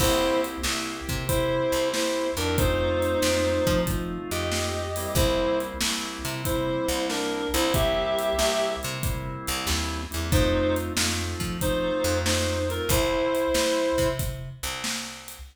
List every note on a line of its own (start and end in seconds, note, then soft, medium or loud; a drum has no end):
0.00 0.57 C2 loud
0.00 0.62 A#3 medium
0.00 0.62 C4 medium
0.00 0.41 E4 loud
0.00 0.62 E4 medium
0.00 0.62 G4 medium
0.00 0.41 C5 loud
0.00 kick loud
0.00 crash loud
0.44 closed hi-hat medium
0.63 1.01 C2 medium
0.63 1.25 A#3 medium
0.63 1.25 C4 medium
0.63 1.25 E4 medium
0.63 1.25 G4 medium
0.63 snare loud
1.09 1.60 C3 medium
1.09 kick medium
1.09 closed hi-hat medium
1.28 2.27 A#3 medium
1.28 2.27 C4 medium
1.28 1.89 E4 loud
1.28 2.27 E4 medium
1.28 2.27 G4 medium
1.28 1.89 C5 loud
1.28 kick loud
1.28 closed hi-hat loud
1.72 2.32 C2 medium
1.72 closed hi-hat medium
1.93 2.31 E4 medium
1.93 2.31 C5 medium
1.93 snare loud
2.37 3.15 F2 medium
2.37 2.57 A#3 medium
2.37 2.57 C4 medium
2.37 2.56 D4 medium
2.37 2.57 E4 medium
2.37 2.57 G4 medium
2.37 2.56 A#4 loud
2.37 closed hi-hat medium
2.58 3.19 A3 medium
2.58 3.19 C4 loud
2.58 3.81 D#4 loud
2.58 3.19 D#4 medium
2.58 3.19 F4 medium
2.58 3.81 C5 loud
2.58 kick loud
2.58 closed hi-hat loud
3.02 closed hi-hat medium
3.22 3.60 F2 medium
3.22 3.84 A3 medium
3.22 3.84 C4 medium
3.22 3.84 D#4 medium
3.22 3.84 F4 medium
3.22 snare loud
3.67 4.18 F3 loud
3.67 kick loud
3.67 closed hi-hat medium
3.86 4.85 A3 medium
3.86 4.85 C4 medium
3.86 4.85 D#4 medium
3.86 4.85 F4 medium
3.86 kick loud
3.86 closed hi-hat loud
4.31 5.07 F2 medium
4.31 5.15 G4 medium
4.31 5.15 D#5 medium
4.31 closed hi-hat medium
4.52 snare loud
4.96 5.78 G3 medium
4.96 5.78 A#3 loud
4.96 5.78 C4 medium
4.96 5.78 E4 medium
4.96 open hi-hat medium
5.15 5.74 C2 loud
5.15 5.59 E4 medium
5.15 5.59 C5 loud
5.15 kick loud
5.15 closed hi-hat loud
5.60 closed hi-hat medium
5.81 6.18 C2 medium
5.81 6.42 G3 medium
5.81 6.42 A#3 medium
5.81 6.42 C4 medium
5.81 6.42 E4 medium
5.81 snare loud
6.25 6.76 C3 medium
6.25 closed hi-hat medium
6.44 7.42 G3 medium
6.44 7.42 A#3 medium
6.44 7.42 C4 medium
6.44 7.42 E4 medium
6.44 7.06 E4 medium
6.44 7.06 C5 medium
6.44 kick medium
6.44 closed hi-hat loud
6.88 7.49 C2 loud
6.88 closed hi-hat medium
7.10 7.49 D4 medium
7.10 7.49 A#4 medium
7.10 snare loud
7.54 8.33 C2 loud
7.54 7.72 G3 medium
7.54 7.72 A#3 medium
7.54 7.72 C4 medium
7.54 7.72 E4 medium
7.54 7.73 E4 loud
7.54 7.73 C5 loud
7.54 closed hi-hat medium
7.74 8.36 G3 loud
7.74 8.36 A#3 medium
7.74 8.36 C4 medium
7.74 8.36 E4 medium
7.74 8.70 G4 loud
7.74 8.70 E5 loud
7.74 kick loud
7.74 closed hi-hat loud
8.19 closed hi-hat medium
8.38 8.76 C2 medium
8.38 8.99 G3 medium
8.38 8.99 A#3 medium
8.38 8.99 C4 medium
8.38 8.99 E4 medium
8.38 snare loud
8.83 9.36 C3 loud
8.83 closed hi-hat medium
9.03 10.02 G3 medium
9.03 10.02 A#3 medium
9.03 10.02 C4 medium
9.03 10.02 E4 medium
9.03 kick loud
9.03 closed hi-hat loud
9.47 9.67 C2 loud
9.47 closed hi-hat medium
9.67 10.07 D#2 loud
9.67 snare loud
10.11 10.32 E2 medium
10.11 10.29 G3 medium
10.11 10.29 A#3 medium
10.11 10.29 C4 medium
10.11 10.29 E4 medium
10.11 closed hi-hat medium
10.32 10.91 F2 medium
10.32 10.93 A3 medium
10.32 10.93 C4 medium
10.32 10.93 D#4 medium
10.32 10.75 D#4 loud
10.32 10.93 F4 medium
10.32 10.75 C5 loud
10.32 kick loud
10.32 closed hi-hat loud
10.76 closed hi-hat medium
10.96 11.35 F2 medium
10.96 11.58 A3 medium
10.96 11.58 C4 medium
10.96 11.58 D#4 medium
10.96 11.58 F4 medium
10.96 snare loud
11.40 11.91 F3 medium
11.40 kick medium
11.40 closed hi-hat medium
11.61 12.60 A3 medium
11.61 12.60 C4 medium
11.61 12.18 D#4 medium
11.61 12.60 D#4 medium
11.61 12.60 F4 medium
11.61 12.18 C5 loud
11.61 kick loud
11.61 closed hi-hat loud
12.04 12.80 F2 loud
12.04 closed hi-hat medium
12.26 12.69 D#4 medium
12.26 12.69 C5 medium
12.26 snare loud
12.69 12.88 A3 medium
12.69 12.88 C4 medium
12.69 12.88 D#4 medium
12.69 12.88 F4 medium
12.69 12.89 A#4 loud
12.69 closed hi-hat medium
12.89 13.47 C2 loud
12.89 14.09 E4 loud
12.89 14.09 C5 loud
12.89 kick loud
12.89 closed hi-hat loud
13.35 closed hi-hat medium
13.54 13.92 C2 medium
13.54 snare loud
13.98 14.49 C3 medium
13.98 kick medium
13.98 closed hi-hat medium
14.19 kick loud
14.19 closed hi-hat loud
14.63 15.39 C2 medium
14.63 closed hi-hat medium
14.84 snare loud
15.28 closed hi-hat medium